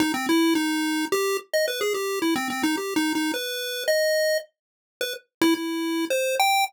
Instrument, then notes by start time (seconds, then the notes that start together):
lead 1 (square)
0.00 D#4
0.14 C4
0.29 E4
0.55 D#4
1.12 G4
1.53 D#5
1.68 B4
1.81 G#4
1.94 G4
2.22 E4
2.36 C4
2.50 C4
2.63 D#4
2.77 G4
2.96 D#4
3.15 D#4
3.34 B4
3.88 D#5
5.01 B4
5.42 E4
5.55 E4
6.10 C5
6.39 G5